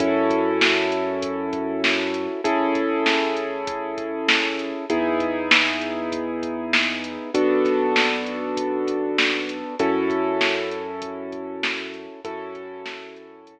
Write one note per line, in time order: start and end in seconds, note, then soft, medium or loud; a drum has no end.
0.00 2.27 F#2 loud
0.00 2.41 C#4 medium
0.00 2.41 E4 medium
0.00 2.41 F#4 medium
0.00 2.41 A4 medium
0.00 kick loud
0.00 closed hi-hat loud
0.30 kick medium
0.30 closed hi-hat medium
0.61 snare loud
0.92 closed hi-hat medium
1.22 kick loud
1.22 closed hi-hat loud
1.53 kick loud
1.53 closed hi-hat medium
1.84 snare loud
2.14 closed hi-hat medium
2.44 4.72 A1 loud
2.44 4.85 C#4 medium
2.44 4.85 E4 medium
2.44 4.85 G#4 medium
2.44 4.85 A4 medium
2.44 kick loud
2.44 closed hi-hat loud
2.75 kick medium
2.75 closed hi-hat medium
3.06 snare loud
3.37 closed hi-hat medium
3.67 kick loud
3.67 closed hi-hat loud
3.98 kick medium
3.98 closed hi-hat medium
4.28 snare loud
4.59 closed hi-hat medium
4.90 7.17 E2 medium
4.90 7.30 B3 medium
4.90 7.30 D#4 medium
4.90 7.30 E4 medium
4.90 7.30 G#4 medium
4.90 kick loud
4.90 closed hi-hat loud
5.20 kick loud
5.20 closed hi-hat medium
5.51 snare loud
5.82 closed hi-hat medium
6.12 kick loud
6.12 closed hi-hat loud
6.43 kick medium
6.43 closed hi-hat medium
6.73 snare loud
7.04 closed hi-hat medium
7.34 9.62 B1 medium
7.34 9.75 B3 medium
7.34 9.75 D4 medium
7.34 9.75 F#4 medium
7.34 9.75 A4 medium
7.34 kick loud
7.34 closed hi-hat loud
7.65 kick medium
7.65 snare soft
7.65 closed hi-hat medium
7.96 snare loud
8.27 closed hi-hat medium
8.57 kick loud
8.57 closed hi-hat loud
8.88 kick medium
8.88 closed hi-hat medium
9.18 snare loud
9.49 closed hi-hat medium
9.79 12.07 F#2 medium
9.79 12.20 C#4 medium
9.79 12.20 E4 medium
9.79 12.20 F#4 medium
9.79 12.20 A4 medium
9.79 kick loud
9.79 closed hi-hat loud
10.10 kick medium
10.10 closed hi-hat medium
10.41 snare loud
10.71 closed hi-hat medium
11.02 kick loud
11.02 closed hi-hat loud
11.32 kick medium
11.32 closed hi-hat medium
11.63 snare loud
11.94 closed hi-hat medium
12.24 13.59 F#2 loud
12.24 13.59 C#4 medium
12.24 13.59 E4 medium
12.24 13.59 F#4 medium
12.24 13.59 A4 loud
12.24 kick loud
12.24 closed hi-hat loud
12.55 kick loud
12.55 closed hi-hat medium
12.86 snare loud
13.16 closed hi-hat medium
13.47 kick medium
13.47 closed hi-hat loud